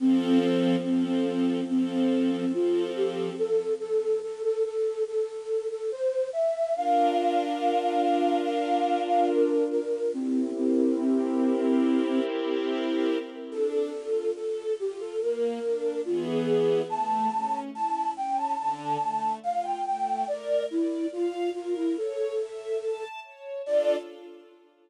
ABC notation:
X:1
M:4/4
L:1/16
Q:1/4=71
K:F
V:1 name="Flute"
C2 C2 C C C2 C3 C F2 G2 | A2 A2 A A A2 A3 A c2 e2 | f2 f2 f f f2 f3 f B2 B2 | C2 C2 C6 z6 |
[K:Dm] A4 A2 G A B4 F ^G G2 | a4 a2 g a a4 f g g2 | d2 E2 F2 F E A6 z2 | d4 z12 |]
V:2 name="String Ensemble 1"
[F,CA]4 [F,CA]4 [F,CA]4 [F,CA]4 | z16 | [DFB]16 | [CEGB]16 |
[K:Dm] D2 F2 A2 F2 B,2 D2 [E,=B,^G]4 | A,2 ^C2 E2 C2 D,2 A,2 F2 A,2 | B2 d2 f2 B2 ^c2 e2 a2 c2 | [DFA]4 z12 |]